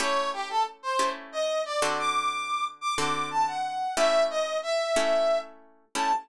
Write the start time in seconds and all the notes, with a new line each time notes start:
0.00 A3 C#4 E4 G4 C#5
0.33 G4
0.50 A4
0.83 C5
0.99 A3 C#4 E4 G4
1.32 D#5
1.65 D5
1.82 D3 C4 F#4 A4
1.98 D6
2.81 D6
2.97 D3 C4 F#4 A4 D6
3.31 A5
3.47 F#5
3.97 A3 C#4 E4 G4 E5
4.30 D#5
4.63 E5
4.96 A3 C#4 E4 G4
5.95 A3 C#4 E4 G4 A5